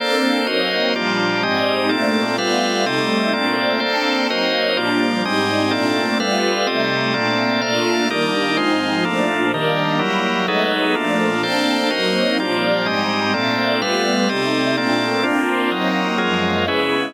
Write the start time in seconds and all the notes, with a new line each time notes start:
0.00 A#3 C4 D4 A4 C5 D5
0.47 F#3 A#3 C4 D#4 F#4 A#4 C5 D#5
0.95 A#2 F3 G3 A#3 D4 F4 G4 D5
1.43 G#2 G3 G#3 C4 D#4 G4 D#5
1.89 A#2 A3 A#3 C4 D4 A4 D5
2.38 G3 A3 B3 F4 A4 B4 F5
2.84 C3 G3 A3 C4 D#4 G4 A4 D#5
3.33 A#2 A3 A#3 C4 D4 A4 D5
3.80 A#3 C4 D4 A4 C5 D5
4.29 F#3 A#3 C4 D#4 F#4 A#4 C5 D#5
4.74 A#2 F3 G3 A#3 D4 F4 G4 D5
5.23 G#2 G3 G#3 C4 D#4 G4 D#5
5.71 A#2 A3 A#3 C4 D4 A4 D5
6.20 G3 A3 B3 F4 A4 B4 F5
6.67 C3 G3 A3 C4 D#4 G4 A4 D#5
7.13 A#2 A3 A#3 C4 D4 A4 D5
7.61 A#2 A3 A#3 D4 F4 A4 D5 F5
8.09 D#3 G3 A#3 D4 D#4 G4 A#4 D5
8.57 G#2 F3 G#3 C4 D#4 F4 C5
9.05 A#2 F3 A3 A#3 D4 F4 A4
9.51 D#3 G3 A#3 D4 G4 A#4
9.98 F#3 G3 A#3 E4 G4 A#4
10.47 F#3 G#3 A3 B3 D#4 G#4 A4 B4
10.95 A#2 F3 A3 A#3 D4 F4 A4
11.42 A#3 C4 D4 A4 C5 D5
11.90 F#3 A#3 C4 D#4 F#4 A#4 C5 D#5
12.40 A#2 F3 G3 A#3 D4 F4 G4 D5
12.85 G#2 G3 G#3 C4 D#4 G4 D#5
13.34 A#2 A3 A#3 C4 D4 A4 D5
13.81 G3 A3 B3 F4 A4 B4 F5
14.28 C3 G3 A3 C4 D#4 G4 A4 D#5
14.77 A#2 A3 A#3 C4 D4 A4 D5
15.23 A#3 C4 D4 F4
15.71 F#3 A#3 C4 D#4 A#4
16.18 F#2 F3 F#3 G#3 A#3 F4 G#4 A#4
16.66 C#3 G#3 B3 C#4 E4 G#4 B4